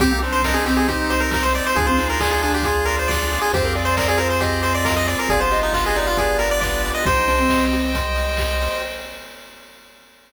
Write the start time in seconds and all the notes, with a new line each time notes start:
0.00 C2 C4 D#4 G4, kick, closed hi-hat
0.11 A#3
0.22 D4 C5, open hi-hat
0.32 C5
0.42 D4 A#4 D#5, kick, snare
0.54 D4 G#4
0.66 C4 G4, open hi-hat
0.77 G#4
0.88 D#4 G4 C5, kick, closed hi-hat
1.10 C5 D#5, open hi-hat
1.20 A#4
1.31 G4 A#4, kick, snare
1.43 C5
1.53 C5 D5, open hi-hat
1.66 C5
1.75 D2 D4 F4 G#4, kick, closed hi-hat
1.87 C4 C5
1.97 D#4 G#4, open hi-hat
2.10 A#4
2.20 D#4 G#4 D5, kick, clap
2.31 D#4 G#4
2.42 D4 F4 G#4, open hi-hat
2.54 G4
2.63 F4 G#4, kick, closed hi-hat
2.85 A#4 D5, open hi-hat
2.99 C5
3.08 F4 D5, kick, snare
3.31 G#4, open hi-hat
3.41 G#4
3.52 F2 C4 F4 G4 G#4 C5, kick, closed hi-hat
3.64 A#4
3.75 G#4 D5, open hi-hat
3.85 C5
3.96 A#4 C5 D5, kick, clap
4.08 G#4 D5
4.18 F4 A#4 C5, open hi-hat
4.30 C5
4.41 G4 G#4 D#5, kick, closed hi-hat
4.62 C5, open hi-hat
4.75 D5
4.85 F4 A#4, kick, snare
4.97 D#5
5.07 G#4 D5, open hi-hat
5.19 A#4
5.29 G1 B3 D4 F4 G4 G#4 D5, kick, closed hi-hat
5.40 C5
5.51 G4 D#5, open hi-hat
5.63 D#4
5.73 F4 B4 D#5, kick, clap
5.85 G#4 D#5
5.95 D#4 D5, open hi-hat
6.07 F4
6.17 F4 G#4 D5, kick, closed hi-hat
6.39 G4 A#4, open hi-hat
6.51 D5
6.60 B4 D5, kick, clap
6.84 D5, open hi-hat
6.94 D#5
7.06 C2 D#4 G4 C5 D#5 G5, kick, closed hi-hat
7.27 D4 C5, open hi-hat
7.39 C4
7.49 D#5, kick, snare
7.72 G4, open hi-hat
7.93 C5, kick, closed hi-hat
8.15 D#5, open hi-hat
8.37 G4, kick, clap
8.60 C5, open hi-hat